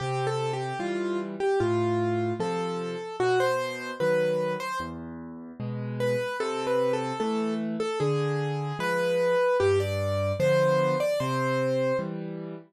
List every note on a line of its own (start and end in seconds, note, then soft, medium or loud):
0.00 0.73 C3 medium
0.00 0.25 G4 medium
0.27 0.52 A4 medium
0.53 0.79 G4 medium
0.79 1.35 E3 medium
0.79 1.35 G3 medium
0.79 1.19 F4 medium
1.40 1.59 G4 medium
1.60 2.33 A2 medium
1.60 2.33 F4 medium
2.40 2.96 C3 medium
2.40 2.96 F3 medium
2.40 3.16 A4 medium
3.20 3.92 B2 medium
3.20 3.39 F#4 medium
3.40 3.91 C5 medium
4.00 4.56 D#3 medium
4.00 4.56 F#3 medium
4.00 4.53 B4 medium
4.60 4.79 C5 medium
4.80 5.52 E2 medium
5.60 6.16 B2 medium
5.60 6.16 G#3 medium
6.00 6.37 B4 medium
6.40 7.12 C3 loud
6.40 6.66 A4 medium
6.67 6.92 B4 medium
6.93 7.19 A4 medium
7.20 7.76 E3 medium
7.20 7.76 A3 medium
7.20 7.54 A4 medium
7.80 7.99 A4 medium
8.00 8.73 D3 medium
8.00 8.78 G#4 medium
8.79 9.35 F3 medium
8.79 9.35 G#3 medium
8.79 9.57 B4 medium
9.60 10.33 G2 medium
9.60 9.79 G4 medium
9.80 10.32 D5 medium
10.40 10.96 D3 medium
10.40 10.96 F3 medium
10.40 10.96 B3 medium
10.40 10.98 C5 medium
11.00 11.19 D5 medium
11.20 11.93 C3 loud
11.20 11.97 C5 medium
11.99 12.55 E3 medium
11.99 12.55 G3 medium